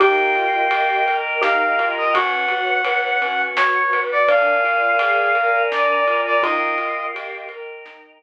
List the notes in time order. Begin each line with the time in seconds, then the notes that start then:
0.00 D#2 D#4 G4 A#4 D#5 F5 G5, kick, ride
0.35 F4, ride
0.71 G4, ride
1.06 A#4 D#5 G5 A#5, ride
1.41 D#4 G4 F5, snare
1.79 F4, ride
1.98 D#5
2.13 B1 C#4 F#4 B4 C#5 F#5, kick, ride
2.49 F#4, ride
2.85 B4, ride
3.21 C#4 F#4 B4 F#5, ride
3.56 F#4 C#5, snare
3.93 B4, ride
4.12 D5
4.28 A#1 D4 A#4 D5 F5 G#5, kick, ride
4.64 F4, ride
4.99 G#4, ride
5.35 A#4 D5 G#5 A#5, ride
5.71 D4 D5, snare
6.07 F4, ride
6.26 D5
6.42 D#2 D#4 F4 A#4 D#5 F5 G5, kick, ride
6.78 F4, ride
7.14 G4, ride
7.49 A#4 D#5 G5 A#5, ride
7.85 D#4, snare